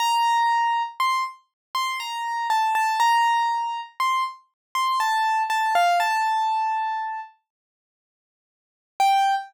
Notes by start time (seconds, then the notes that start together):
0.00 A#5
1.00 C6
1.75 C6
2.00 A#5
2.50 A5
2.75 A5
3.00 A#5
4.00 C6
4.75 C6
5.00 A5
5.50 A5
5.75 F5
6.00 A5
9.00 G5